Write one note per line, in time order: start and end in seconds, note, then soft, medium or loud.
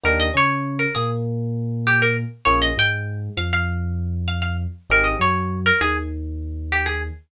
0.04 0.30 D#2 loud
0.04 0.28 A#3 medium
0.04 0.28 D4 medium
0.04 0.28 D#4 medium
0.04 0.28 G4 medium
0.04 0.19 A#4 loud
0.20 0.34 D#5 medium
0.34 0.86 C#3 loud
0.34 0.85 C#4 medium
0.34 0.79 C#5 medium
0.79 0.94 A#4 medium
0.95 2.24 A#2 loud
0.95 2.24 A#3 loud
0.95 1.09 G#4 loud
1.87 2.01 G4 loud
2.02 2.16 A#4 loud
2.45 2.72 A#1 loud
2.45 2.70 A#3 medium
2.45 2.70 C#4 medium
2.45 2.70 F4 medium
2.45 2.70 G#4 medium
2.45 2.60 C#5 loud
2.62 2.76 D#5 loud
2.77 3.28 G#2 loud
2.77 3.29 G#3 loud
2.77 3.19 G5 loud
3.37 4.66 F2 loud
3.37 4.66 F3 loud
3.37 3.52 F5 loud
3.53 4.14 F5 loud
4.28 4.41 F5 loud
4.42 4.56 F5 medium
4.90 5.15 G#1 loud
4.90 5.14 C4 medium
4.90 5.14 D#4 medium
4.90 5.14 G4 medium
4.90 5.14 G#4 medium
4.90 5.06 A#4 loud
5.04 5.18 D#5 medium
5.19 5.71 F#2 medium
5.19 5.70 F#3 medium
5.19 5.59 C#5 medium
5.66 5.80 A#4 loud
5.81 7.10 D#2 loud
5.81 7.10 D#3 medium
5.81 5.95 G#4 loud
6.72 6.86 G4 medium
6.86 7.00 G#4 loud